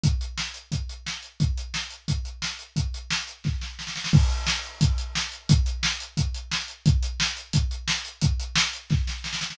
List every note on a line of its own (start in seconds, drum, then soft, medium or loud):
0.04 kick medium
0.04 closed hi-hat medium
0.21 closed hi-hat medium
0.38 snare medium
0.54 closed hi-hat medium
0.72 kick medium
0.72 closed hi-hat medium
0.89 closed hi-hat medium
1.06 snare medium
1.23 closed hi-hat medium
1.40 kick medium
1.40 closed hi-hat medium
1.57 closed hi-hat medium
1.74 snare medium
1.90 closed hi-hat medium
2.08 kick medium
2.08 closed hi-hat medium
2.25 closed hi-hat medium
2.42 snare medium
2.59 closed hi-hat medium
2.76 kick medium
2.76 closed hi-hat medium
2.94 closed hi-hat medium
3.11 snare loud
3.28 closed hi-hat medium
3.44 kick medium
3.44 snare medium
3.61 snare medium
3.79 snare medium
3.87 snare medium
3.96 snare medium
4.04 snare medium
4.13 kick loud
4.13 crash loud
4.30 closed hi-hat medium
4.47 snare loud
4.63 closed hi-hat medium
4.81 kick medium
4.81 closed hi-hat loud
4.98 closed hi-hat medium
5.15 snare loud
5.32 closed hi-hat medium
5.49 kick loud
5.49 closed hi-hat loud
5.66 closed hi-hat medium
5.83 snare loud
6.00 closed hi-hat medium
6.17 kick medium
6.17 closed hi-hat medium
6.34 closed hi-hat medium
6.51 snare loud
6.68 closed hi-hat medium
6.86 kick loud
6.86 closed hi-hat medium
7.03 closed hi-hat medium
7.20 snare loud
7.37 closed hi-hat medium
7.53 kick medium
7.53 closed hi-hat loud
7.71 closed hi-hat medium
7.88 snare loud
8.05 closed hi-hat medium
8.21 kick medium
8.21 closed hi-hat loud
8.40 closed hi-hat medium
8.56 snare loud
8.73 closed hi-hat medium
8.90 kick medium
8.90 snare medium
9.07 snare medium
9.24 snare medium
9.33 snare medium
9.41 snare medium
9.50 snare loud